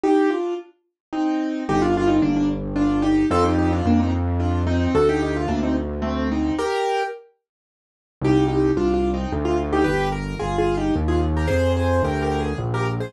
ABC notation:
X:1
M:3/4
L:1/16
Q:1/4=110
K:Cm
V:1 name="Acoustic Grand Piano"
[EG]2 [DF]2 z4 [CE]4 | [K:Gm] [EG] [DF] [DF] [CE] [B,D] [B,D] z2 [DF]2 [EG]2 | [FA] [EG] [EG] [DF] [B,D] [CE] z2 [DF]2 [CE]2 | [^FA] [EG] [EG] =F [B,D] [CE] z2 [A,C]2 [CE]2 |
[GB]4 z8 | [K:Cm] [EG]2 [EG]2 (3[DF]2 [DF]2 [CE]2 z F z [EG] | [G=B]2 _B2 (3[FA]2 [FA]2 [EG]2 z [FA] z [GB] | [Ac]2 [Ac]2 (3[GB]2 [GB]2 A2 z [GB] z [Ac] |]
V:2 name="Acoustic Grand Piano" clef=bass
z12 | [K:Gm] G,,,4 G,,,8 | F,,4 F,,8 | D,,4 D,,8 |
z12 | [K:Cm] C,,4 C,,4 D,,4 | G,,,4 G,,,4 E,,4 | F,,4 D,,4 B,,,4 |]